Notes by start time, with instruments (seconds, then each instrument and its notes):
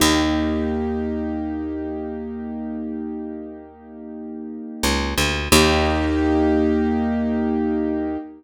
0.00 electric bass (finger) D#2, acoustic grand piano A#3 D#4 G4
4.83 electric bass (finger) C#2
5.18 electric bass (finger) D2
5.52 electric bass (finger) D#2, acoustic grand piano A#3 D#4 G4